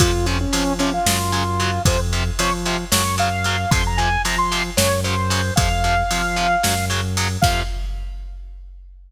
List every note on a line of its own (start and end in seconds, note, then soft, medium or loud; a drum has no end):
0.00 0.45 F2 loud
0.00 0.11 C3 loud
0.00 0.11 F3 loud
0.00 0.26 F4 medium
0.00 kick loud
0.00 ride loud
0.26 0.37 C3 loud
0.26 0.37 F3 medium
0.26 0.38 C#4 medium
0.26 ride medium
0.40 0.73 C#4 medium
0.53 0.63 C3 loud
0.53 0.63 F3 loud
0.53 0.99 F3 loud
0.53 ride loud
0.79 0.90 C3 loud
0.79 0.90 F3 loud
0.79 0.92 C#4 medium
0.79 ride medium
0.94 1.82 F4 medium
1.06 1.79 F#2 loud
1.06 1.17 C#3 loud
1.06 1.17 F#3 loud
1.06 snare loud
1.32 1.43 C#3 loud
1.32 1.43 F#3 loud
1.32 ride medium
1.60 1.70 C#3 loud
1.60 1.70 F#3 loud
1.60 ride medium
1.85 2.30 F2 loud
1.85 1.97 C3 loud
1.85 1.97 F3 loud
1.85 2.00 C5 medium
1.85 kick loud
1.85 ride loud
2.13 2.23 C3 loud
2.13 2.23 F3 loud
2.13 ride medium
2.39 2.50 C3 medium
2.39 2.50 F3 medium
2.39 2.84 F3 loud
2.39 2.53 C#5 loud
2.39 ride loud
2.65 2.77 C3 loud
2.65 2.77 F3 loud
2.65 ride medium
2.92 3.65 F#2 loud
2.92 3.02 C#3 loud
2.92 3.02 F#3 loud
2.92 3.16 C#5 medium
2.92 snare loud
3.18 3.29 C#3 medium
3.18 3.29 F#3 loud
3.18 3.70 F5 medium
3.18 ride medium
3.44 3.56 C#3 medium
3.44 3.56 F#3 loud
3.44 ride medium
3.71 4.17 F2 loud
3.71 3.82 C3 loud
3.71 3.82 F3 loud
3.71 3.84 C6 loud
3.71 kick loud
3.71 ride loud
3.87 3.99 A#5 medium
3.97 4.09 C3 medium
3.97 4.09 F3 medium
3.97 4.22 G#5 medium
3.97 ride medium
4.25 4.35 C3 loud
4.25 4.35 F3 medium
4.25 4.70 F3 loud
4.25 4.38 A#5 medium
4.25 ride loud
4.38 4.63 C6 loud
4.52 4.62 C3 loud
4.52 4.62 F3 loud
4.52 ride medium
4.77 5.51 F#2 loud
4.77 4.88 C#3 loud
4.77 4.88 F#3 medium
4.77 5.00 C#5 medium
4.77 snare loud
5.04 5.15 C#3 medium
5.04 5.15 F#3 loud
5.04 5.54 C5 medium
5.04 ride medium
5.30 5.41 C#3 medium
5.30 5.41 F#3 medium
5.30 ride medium
5.56 6.03 F2 loud
5.56 5.68 C3 loud
5.56 5.68 F3 loud
5.56 6.85 F5 loud
5.56 kick loud
5.56 ride loud
5.84 5.95 C3 medium
5.84 5.95 F3 loud
5.84 ride medium
6.11 6.21 C3 loud
6.11 6.21 F3 loud
6.11 6.56 F3 loud
6.11 ride loud
6.36 6.47 C3 loud
6.36 6.47 F3 loud
6.36 ride medium
6.63 7.37 F#2 loud
6.63 6.74 C#3 loud
6.63 6.74 F#3 loud
6.63 snare loud
6.90 7.00 C#3 loud
6.90 7.00 F#3 medium
6.90 ride medium
7.17 7.28 C#3 loud
7.17 7.28 F#3 loud
7.17 ride medium
7.42 7.62 F2 loud
7.42 7.62 C3 medium
7.42 7.62 F3 loud
7.42 7.60 F5 loud
7.42 kick loud
7.42 crash loud